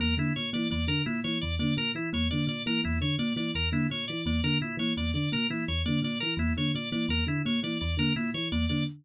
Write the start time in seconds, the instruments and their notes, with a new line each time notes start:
0.00 electric piano 1 E2, kalimba A#3, drawbar organ A#4
0.17 electric piano 1 D3, kalimba A#3, drawbar organ E4
0.36 electric piano 1 A#2, drawbar organ C#5
0.53 electric piano 1 E3, kalimba A#3, drawbar organ D5
0.71 electric piano 1 E2, kalimba A#3, drawbar organ D5
0.88 electric piano 1 D3, drawbar organ A#4
1.06 electric piano 1 A#2, kalimba A#3, drawbar organ E4
1.24 electric piano 1 E3, kalimba A#3, drawbar organ C#5
1.41 electric piano 1 E2, drawbar organ D5
1.59 electric piano 1 D3, kalimba A#3, drawbar organ D5
1.77 electric piano 1 A#2, kalimba A#3, drawbar organ A#4
1.95 electric piano 1 E3, drawbar organ E4
2.13 electric piano 1 E2, kalimba A#3, drawbar organ C#5
2.31 electric piano 1 D3, kalimba A#3, drawbar organ D5
2.47 electric piano 1 A#2, drawbar organ D5
2.66 electric piano 1 E3, kalimba A#3, drawbar organ A#4
2.84 electric piano 1 E2, kalimba A#3, drawbar organ E4
3.01 electric piano 1 D3, drawbar organ C#5
3.18 electric piano 1 A#2, kalimba A#3, drawbar organ D5
3.36 electric piano 1 E3, kalimba A#3, drawbar organ D5
3.55 electric piano 1 E2, drawbar organ A#4
3.72 electric piano 1 D3, kalimba A#3, drawbar organ E4
3.90 electric piano 1 A#2, kalimba A#3, drawbar organ C#5
4.08 electric piano 1 E3, drawbar organ D5
4.26 electric piano 1 E2, kalimba A#3, drawbar organ D5
4.44 electric piano 1 D3, kalimba A#3, drawbar organ A#4
4.61 electric piano 1 A#2, drawbar organ E4
4.77 electric piano 1 E3, kalimba A#3, drawbar organ C#5
4.97 electric piano 1 E2, kalimba A#3, drawbar organ D5
5.14 electric piano 1 D3, drawbar organ D5
5.32 electric piano 1 A#2, kalimba A#3, drawbar organ A#4
5.50 electric piano 1 E3, kalimba A#3, drawbar organ E4
5.68 electric piano 1 E2, drawbar organ C#5
5.86 electric piano 1 D3, kalimba A#3, drawbar organ D5
6.02 electric piano 1 A#2, kalimba A#3, drawbar organ D5
6.20 electric piano 1 E3, drawbar organ A#4
6.37 electric piano 1 E2, kalimba A#3, drawbar organ E4
6.57 electric piano 1 D3, kalimba A#3, drawbar organ C#5
6.75 electric piano 1 A#2, drawbar organ D5
6.92 electric piano 1 E3, kalimba A#3, drawbar organ D5
7.09 electric piano 1 E2, kalimba A#3, drawbar organ A#4
7.27 electric piano 1 D3, drawbar organ E4
7.45 electric piano 1 A#2, kalimba A#3, drawbar organ C#5
7.63 electric piano 1 E3, kalimba A#3, drawbar organ D5
7.81 electric piano 1 E2, drawbar organ D5
7.97 electric piano 1 D3, kalimba A#3, drawbar organ A#4
8.16 electric piano 1 A#2, kalimba A#3, drawbar organ E4
8.34 electric piano 1 E3, drawbar organ C#5
8.52 electric piano 1 E2, kalimba A#3, drawbar organ D5
8.69 electric piano 1 D3, kalimba A#3, drawbar organ D5